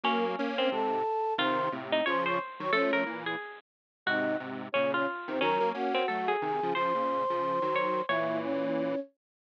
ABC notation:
X:1
M:4/4
L:1/8
Q:"Swing" 1/4=179
K:Db
V:1 name="Flute"
[B,B] z2 [Cc] [=A=a]4 | [cc']2 z2 [cc'] [dd'] z [dd'] | [^C^c]2 z6 | [Ee]2 z2 [Dd] [Dd] z [Cc] |
[Bb]2 [Gg]4 [Aa]2 | [cc']8 | [=E=e]2 [^C^c]4 z2 |]
V:2 name="Harpsichord"
D3 C3 z2 | F3 E d c3 | =A B2 ^G2 z3 | G4 D F3 |
D3 C =A _A3 | c6 d2 | ^c4 z4 |]
V:3 name="Lead 1 (square)"
[G,B,]2 [B,D]2 [A,,C,]2 z2 | [C,E,]2 [=A,,C,]2 [D,F,]2 z [E,G,] | [F,=A,] [F,A,] [B,,=E,]2 z4 | [A,,C,]2 [A,,C,]2 [B,,D,]2 z [C,E,] |
[E,G,] [G,B,] [B,D]2 [G,=A,]2 [C,E,] [D,F,] | [D,F,] [B,,D,]2 [D,F,]2 [E,G,]3 | [B,,=E,]6 z2 |]